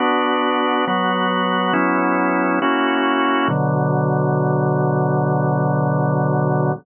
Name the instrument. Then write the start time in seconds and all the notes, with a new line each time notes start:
drawbar organ
0.00 B3 D4 F#4
0.87 F#3 B3 F#4
1.73 F#3 B3 C#4 E4
2.62 A#3 C#4 E4 F#4
3.48 B2 D3 F#3